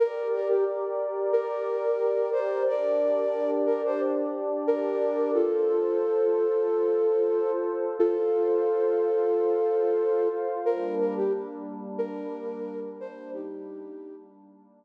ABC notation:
X:1
M:4/4
L:1/16
Q:1/4=90
K:Gm
V:1 name="Flute"
B2 B G z4 B6 c2 | [Bd]6 B c z4 B4 | [FA]16 | [FA]16 |
B2 B G z4 B6 c2 | [EG]6 z10 |]
V:2 name="Pad 2 (warm)"
[GBd]16 | [DGd]16 | [FAc]16 | [Fcf]16 |
[G,B,D]16- | [G,B,D]16 |]